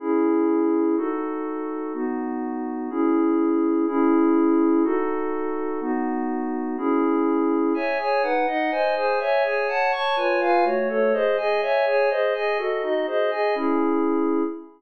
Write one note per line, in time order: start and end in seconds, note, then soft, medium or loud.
0.00 0.96 C#4 medium
0.00 0.96 E4 medium
0.00 0.96 G#4 medium
0.97 1.93 D#4 medium
0.97 1.93 F#4 medium
0.97 1.93 A4 medium
1.94 2.90 B3 medium
1.94 2.90 D#4 medium
1.94 2.90 F#4 medium
2.90 3.86 C#4 medium
2.90 3.86 E4 medium
2.90 3.86 G#4 medium
3.87 4.83 C#4 medium
3.87 4.83 E4 loud
3.87 4.83 G#4 medium
4.84 5.80 D#4 medium
4.84 5.80 F#4 loud
4.84 5.80 A4 medium
5.81 6.77 B3 medium
5.81 6.77 D#4 medium
5.81 6.77 F#4 medium
6.77 7.73 C#4 medium
6.77 7.73 E4 medium
6.77 7.73 G#4 loud
7.74 7.98 C#5 medium
7.74 7.98 E5 medium
7.74 7.98 G#5 medium
7.98 8.22 G#4 medium
7.98 8.22 C#5 medium
7.98 8.22 G#5 medium
8.23 8.46 D#4 medium
8.23 8.46 B4 medium
8.23 8.46 F#5 medium
8.47 8.71 D#4 medium
8.47 8.70 D#5 medium
8.47 8.71 F#5 medium
8.71 8.95 C5 medium
8.71 8.95 D#5 medium
8.71 8.95 G#5 medium
8.95 9.19 G#4 medium
8.95 9.19 C5 medium
8.95 9.19 G#5 medium
9.19 9.43 C#5 medium
9.19 9.43 E5 medium
9.19 9.43 G#5 medium
9.44 9.68 G#4 medium
9.44 9.67 C#5 medium
9.44 9.68 G#5 medium
9.68 9.91 C#5 medium
9.68 9.92 F#5 medium
9.68 9.91 A5 loud
9.92 10.16 C#5 medium
9.92 10.16 A5 medium
9.92 10.16 C#6 medium
10.16 10.40 F4 medium
10.16 10.40 B4 medium
10.16 10.40 C#5 medium
10.16 10.40 G#5 medium
10.40 10.64 F4 medium
10.40 10.64 B4 medium
10.40 10.64 F5 medium
10.40 10.64 G#5 medium
10.64 10.88 A3 medium
10.64 10.88 F#4 medium
10.64 10.88 C#5 medium
10.89 11.13 A3 medium
10.89 11.13 A4 loud
10.89 11.13 C#5 medium
11.13 11.36 G#4 medium
11.13 11.37 C5 medium
11.13 11.36 D#5 medium
11.37 11.61 G#4 medium
11.37 11.61 D#5 medium
11.37 11.61 G#5 medium
11.61 11.85 C#5 medium
11.61 11.85 E5 medium
11.61 11.85 G#5 medium
11.86 12.09 G#4 medium
11.86 12.09 C#5 medium
11.86 12.09 G#5 medium
12.10 12.33 G#4 medium
12.10 12.34 C5 medium
12.10 12.33 D#5 medium
12.34 12.58 G#4 medium
12.34 12.57 D#5 medium
12.34 12.58 G#5 medium
12.58 12.82 F#4 medium
12.58 12.82 A4 medium
12.58 12.82 D#5 medium
12.82 13.06 D#4 medium
12.82 13.06 F#4 medium
12.82 13.06 D#5 medium
13.06 13.30 G#4 medium
13.06 13.30 C5 medium
13.06 13.30 D#5 medium
13.31 13.54 G#4 medium
13.31 13.55 D#5 medium
13.31 13.55 G#5 medium
13.55 14.43 C#4 medium
13.55 14.43 E4 medium
13.55 14.43 G#4 medium